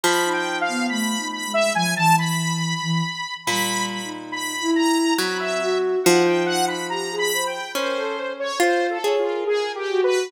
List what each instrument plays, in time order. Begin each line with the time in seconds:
0.04 orchestral harp F3, lead 2 (sawtooth) B5
0.24 ocarina D#4
0.33 lead 2 (sawtooth) G5
0.61 lead 2 (sawtooth) F5
0.68 ocarina B3
0.89 ocarina A3, lead 2 (sawtooth) B5
1.18 ocarina D#4
1.33 lead 2 (sawtooth) B5
1.47 ocarina G#3
1.54 lead 2 (sawtooth) E5
1.75 ocarina F3, lead 2 (sawtooth) G#5
1.96 ocarina E3, lead 2 (sawtooth) A5
2.18 lead 2 (sawtooth) B5
2.83 ocarina E3
3.47 orchestral harp A#2, ocarina G3, lead 2 (sawtooth) B5
3.90 lead 2 (sawtooth) B5
4.04 ocarina D#4
4.32 lead 2 (sawtooth) B5
4.61 ocarina E4
4.76 lead 2 (sawtooth) A#5
5.18 orchestral harp F#3, ocarina C4, lead 2 (sawtooth) B5
5.40 lead 2 (sawtooth) E5
5.60 ocarina F#4
6.04 orchestral harp F3, ocarina D#4, lead 2 (sawtooth) F#5
6.25 lead 2 (sawtooth) G5
6.46 lead 2 (sawtooth) F#5
6.68 lead 2 (sawtooth) B5
6.89 ocarina G4, lead 2 (sawtooth) A#5
7.11 ocarina G#4
7.18 lead 2 (sawtooth) B5
7.32 ocarina C5
7.46 lead 2 (sawtooth) G5
7.75 orchestral harp C#4, ocarina A#4, lead 2 (sawtooth) C5
7.97 ocarina A4
8.40 lead 2 (sawtooth) C#5
8.60 orchestral harp F4, lead 2 (sawtooth) C5
8.90 lead 2 (sawtooth) A4
9.04 orchestral harp G#4, ocarina C#5
9.18 lead 2 (sawtooth) F4
9.25 ocarina A#4
9.47 lead 2 (sawtooth) G#4
9.75 lead 2 (sawtooth) G4
9.90 ocarina F#4
10.04 lead 2 (sawtooth) B4